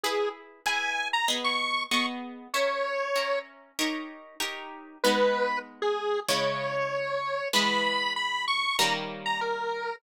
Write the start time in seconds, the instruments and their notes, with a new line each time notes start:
0.04 acoustic guitar (steel) E4 G#4 B4, lead 1 (square) G#4
0.66 acoustic guitar (steel) E4 G#4 B4, lead 1 (square) G#5
1.13 lead 1 (square) A#5
1.28 acoustic guitar (steel) B3 G#4 D#5
1.44 lead 1 (square) C#6
1.91 acoustic guitar (steel) B3 G#4 D#5, lead 1 (square) C#6
2.54 acoustic guitar (steel) C#4 A#4 E5, lead 1 (square) C#5
3.16 acoustic guitar (steel) C#4 A#4 E5
3.79 acoustic guitar (steel) D#4 G4 A#4 C#5
4.40 acoustic guitar (steel) D#4 G4 A#4 C#5
5.04 acoustic guitar (steel) G#3 B3 D#4, lead 1 (square) B4
5.82 lead 1 (square) G#4
6.29 acoustic guitar (steel) C#3 G#3 E4, lead 1 (square) C#5
7.53 acoustic guitar (steel) E3 G#3 B3, lead 1 (square) B5
8.16 lead 1 (square) B5
8.48 lead 1 (square) C#6
8.79 acoustic guitar (steel) D#3 G3 A#3 C#4, lead 1 (square) A#5
9.26 lead 1 (square) A#5
9.41 lead 1 (square) A#4